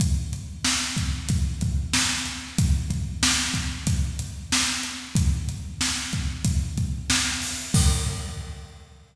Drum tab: CC |--------|--------|--------|x-------|
HH |xx-xxx-x|xx-xxx-x|xx-xxx-o|--------|
SD |--o---o-|--o---o-|--o---o-|--------|
BD |o--ooo--|oo-oo---|o--ooo--|o-------|